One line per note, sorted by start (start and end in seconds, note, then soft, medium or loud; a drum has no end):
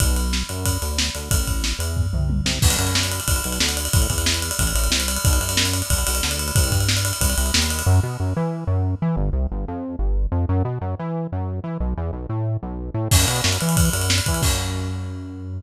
0.00 0.43 B1 medium
0.00 kick loud
0.00 ride loud
0.16 ride medium
0.33 snare loud
0.49 0.78 F#2 medium
0.49 ride medium
0.66 kick medium
0.66 ride loud
0.82 1.10 D2 medium
0.82 ride medium
0.98 snare loud
1.15 1.29 D2 medium
1.15 ride medium
1.31 1.73 A1 medium
1.31 kick loud
1.31 ride loud
1.47 kick medium
1.47 ride medium
1.64 snare loud
1.79 2.07 E2 medium
1.79 ride medium
1.97 kick medium
1.97 floor tom medium
2.13 2.41 C2 medium
2.13 mid tom medium
2.30 high tom medium
2.45 2.59 C2 medium
2.45 snare loud
2.62 2.77 B1 loud
2.62 kick loud
2.62 crash loud
2.70 ride medium
2.79 3.20 F#2 medium
2.79 ride medium
2.87 ride medium
2.95 snare loud
3.03 ride medium
3.12 ride medium
3.20 ride medium
3.27 3.41 B1 medium
3.27 kick loud
3.27 ride loud
3.36 ride medium
3.44 3.59 B1 medium
3.44 ride medium
3.52 ride medium
3.60 3.88 D2 medium
3.60 snare loud
3.69 ride medium
3.77 ride medium
3.85 ride medium
3.93 4.08 A1 loud
3.93 kick loud
3.93 ride loud
4.02 ride medium
4.10 4.52 E2 medium
4.10 kick medium
4.10 ride medium
4.18 ride medium
4.26 snare loud
4.34 ride medium
4.42 ride medium
4.51 ride medium
4.59 4.73 A1 loud
4.59 kick medium
4.59 ride loud
4.67 ride medium
4.75 4.89 A1 medium
4.75 ride medium
4.84 ride medium
4.90 5.18 C2 medium
4.90 snare loud
5.00 ride medium
5.08 ride loud
5.17 ride medium
5.25 5.39 B1 loud
5.25 kick loud
5.25 ride loud
5.33 ride medium
5.41 5.82 F#2 medium
5.41 ride medium
5.49 ride loud
5.57 snare loud
5.65 ride medium
5.73 ride medium
5.82 ride medium
5.90 6.04 B1 medium
5.90 kick loud
5.90 ride loud
5.98 ride medium
6.07 6.22 B1 medium
6.07 ride loud
6.15 ride medium
6.23 6.52 D2 medium
6.23 snare loud
6.31 ride medium
6.39 ride medium
6.48 ride medium
6.56 6.71 C2 loud
6.56 kick loud
6.56 ride loud
6.64 ride medium
6.71 7.12 G2 medium
6.71 kick medium
6.71 ride medium
6.81 ride medium
6.89 snare loud
6.97 ride medium
7.05 ride loud
7.13 ride medium
7.21 7.35 C2 medium
7.21 kick loud
7.21 ride loud
7.30 ride medium
7.38 7.52 C2 loud
7.38 ride medium
7.46 ride medium
7.54 7.83 D#2 medium
7.54 snare loud
7.62 ride medium
7.70 ride medium
7.79 ride medium
7.86 8.00 F#2 loud
8.03 8.17 B2 loud
8.20 8.34 F#2 medium
8.36 8.64 E3 loud
8.67 8.95 F#2 loud
9.02 9.16 E3 loud
9.16 9.30 G1 loud
9.33 9.47 C2 medium
9.52 9.66 G1 loud
9.68 9.96 F2 loud
9.99 10.27 G1 medium
10.32 10.46 F2 loud
10.49 10.63 F#2 loud
10.65 10.79 B2 medium
10.81 10.95 F#2 loud
10.99 11.27 E3 loud
11.32 11.60 F#2 loud
11.64 11.78 E3 medium
11.80 11.94 B1 loud
11.97 12.11 E2 loud
12.13 12.27 B1 medium
12.29 12.57 A2 medium
12.63 12.90 B1 loud
12.94 13.08 A2 loud
13.11 13.26 F#2 loud
13.11 kick loud
13.11 crash loud
13.20 ride medium
13.27 13.41 B2 loud
13.27 ride medium
13.36 ride medium
13.44 13.58 F#2 loud
13.44 snare loud
13.53 ride medium
13.61 13.90 E3 medium
13.61 ride medium
13.69 ride medium
13.77 kick loud
13.77 ride loud
13.85 ride medium
13.93 14.21 F#2 medium
13.93 ride medium
14.02 ride medium
14.10 snare loud
14.18 ride medium
14.26 14.42 E3 loud
14.26 kick medium
14.26 ride medium
14.34 ride medium
14.42 15.61 F#2 medium
14.42 kick loud
14.42 crash loud